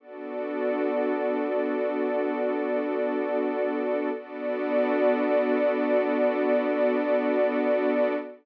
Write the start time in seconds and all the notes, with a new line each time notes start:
0.00 B3 D4 F#4 A4 D5
4.14 B3 D4 F#4 A4 D5